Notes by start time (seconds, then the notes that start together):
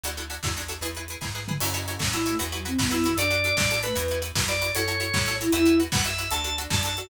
0.03 D2 D4 E4 F#4 A4, closed hi-hat
0.17 D4 E4 F#4 A4, closed hi-hat
0.30 D4 E4 F#4 A4, closed hi-hat
0.43 E2 D4 E4 F#4 A4, kick, snare
0.57 D4 E4 F#4 A4, closed hi-hat
0.68 D4 E4 F#4 A4, closed hi-hat
0.81 E2 E4 G#4 B4, closed hi-hat
0.95 E4 G#4 B4, closed hi-hat
1.08 E4 G#4 B4, closed hi-hat
1.21 G#2 E4 G#4 B4, kick, snare
1.35 E4 G#4 B4
1.48 E4 G#4 B4, mid tom
1.60 F#2 C#4 E4 F#4 A4 C#5, crash
1.74 E4 F#4 A4 C#5, closed hi-hat
1.88 E4 F#4 A4 C#5, closed hi-hat
1.99 A2 E4 F#4 A4 C#5, kick, snare
2.13 E4 F#4 A4 C#5, closed hi-hat
2.26 A3 E4 F#4 A4 C#5, closed hi-hat
2.39 E2 E4 F#4 B4, closed hi-hat
2.52 F#3 E4 F#4 B4, closed hi-hat
2.65 C4 E4 F#4 B4, closed hi-hat
2.78 F#2 B3 E4 F#4 B4, kick, snare
2.90 B3 E4 F#4 B4, closed hi-hat
3.04 E3 E4 F#4 B4, closed hi-hat
3.17 F#2 D4 F#4 A4 D5, closed hi-hat
3.30 D4 F#4 A4, closed hi-hat
3.44 D4 F#4 A4, closed hi-hat
3.57 A2 D4 F#4 A4 D5, kick, snare
3.71 D4 F#4 A4, closed hi-hat
3.83 A3 D4 F#4 A4 B4, closed hi-hat
3.95 E2 E4 F#4 B4, closed hi-hat
4.08 E4 F#4 B4, closed hi-hat
4.22 E4 F#4 B4, closed hi-hat
4.35 F#2 E4 F#4 B4, kick, snare
4.48 E4 F#4 B4 D5, closed hi-hat
4.61 E4 F#4 B4, closed hi-hat
4.75 F#2 E4 F#4 A4 C#5, closed hi-hat
4.88 E4 F#4 A4 C#5, closed hi-hat
5.00 E4 F#4 A4 C#5, closed hi-hat
5.13 A2 E4 F#4 A4 C#5, kick, snare
5.26 E4 F#4 A4 C#5, closed hi-hat
5.40 E4 F#4 A4 C#5, closed hi-hat
5.52 E2 E4 F#4 B4 E5, closed hi-hat
5.66 E4 F#4 B4, closed hi-hat
5.80 E4 F#4 B4, closed hi-hat
5.92 F#2 E4 F#4 B4 F#5, kick, snare
6.04 E4 F#4 B4 E5, closed hi-hat
6.18 E4 F#4 B4, closed hi-hat
6.31 D2 D4 F#4 A4 A5, closed hi-hat
6.44 D4 F#4 A4, closed hi-hat
6.58 D4 F#4 A4, closed hi-hat
6.70 F#2 D4 F#4 A4 A5, kick, snare
6.83 D4 F#4 A4 A5, closed hi-hat
6.96 D4 F#4 A4, closed hi-hat